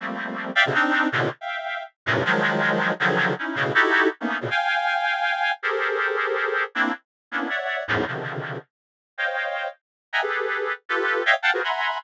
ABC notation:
X:1
M:3/4
L:1/16
Q:1/4=160
K:none
V:1 name="Clarinet"
[F,G,A,_B,C]6 [defg] [=B,,C,_D,=D,] [CD_E]4 | [A,,_B,,=B,,C,D,]2 z [efg]5 z2 [_G,,=G,,A,,_B,,C,]2 | [_E,F,_G,_A,]8 [_D,=D,E,F,G,]4 | [_D_E=E]2 [A,,B,,_D,]2 [_E=E_G=GA]4 z [A,_B,=B,D_E]2 [A,,_B,,=B,,D,] |
[fg_a]12 | [G_A=A_Bc]12 | [_B,CDE]2 z4 [B,=B,_D=DE]2 [_d=de_g]4 | [E,,_G,,_A,,=A,,]2 [B,,C,_D,=D,_E,F,]6 z4 |
z2 [c_d_efg]6 z4 | [_e=e_g=g_a_b] [G_A=A=B]6 z [FGAB]4 | [_d_e=efg] z [f_g=ga] [F_G_A_B=Bc] [e_g_a_b=bc']4 z4 |]